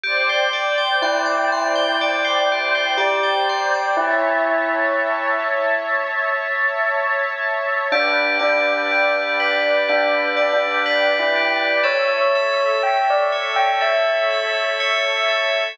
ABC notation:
X:1
M:4/4
L:1/16
Q:1/4=61
K:Glyd
V:1 name="Tubular Bells"
z4 E8 G4 | E6 z10 | D2 D6 (3D4 D4 E4 | c4 g d z g e8 |]
V:2 name="Tubular Bells"
G =c d g =c' d' c' g d c G c d g c' d' | z16 | G2 d2 G2 B2 G2 d2 B2 G2 | A2 e2 A2 c2 A2 e2 c2 A2 |]
V:3 name="Synth Bass 2" clef=bass
G,,,8 G,,,8 | A,,,8 A,,,8 | G,,,8 G,,,8 | A,,,8 A,,,8 |]
V:4 name="Pad 2 (warm)"
[=cdg]16 | [cea]16 | [Bdg]16 | [Ace]16 |]